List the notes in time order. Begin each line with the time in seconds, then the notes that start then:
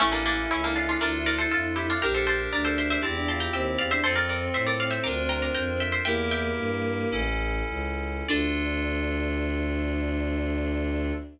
0.00 A1 A3 C#4 E4 A4
0.12 A#3 D4
0.26 A#3 D4
0.50 C#2 C#4 E4
0.64 A#3 D4
0.76 D4 F4
0.89 D4 F4
1.00 D2 D4 F4 A4 A#4 D5
1.26 A#4 D5
1.38 A4 C5
1.51 F2 F4 A4
1.76 E4 G4
1.90 D4 F4
2.01 A#1 D4 G4 A#4
2.14 A4 C5
2.26 G4 A4 C5
2.52 D2 D4 A#4 D5
2.65 A4 C5
2.78 C5 E5
2.90 C5 E5
3.01 E2 C4 E4 G4 A5 C6
3.16 D4
3.27 F4 A5 C6
3.40 G5 A#5
3.53 D#2 C4 E5 G5
3.78 E2 D5 F5
3.91 D4 C5 E5
4.03 F2 C4 F4 A4 C5
4.16 A#4 D5
4.29 A#4 D5
4.54 A2 C5 E5
4.66 A#4 D5
4.80 D5 F5
4.91 C5 E5
5.04 D2 D4 F4 A#4 A#5 D6
5.29 G5 A#5
5.42 A#5 D6
5.54 F2 G5 A#5
5.80 E5 G5
5.92 C5 E5
6.05 E2 A#3 E4 G4 A#4 E5 G5
6.31 E5 G5
6.57 G2
7.11 A1 C#4 E4 A4
7.68 C#2
8.28 D2 D4 F4 A4 D5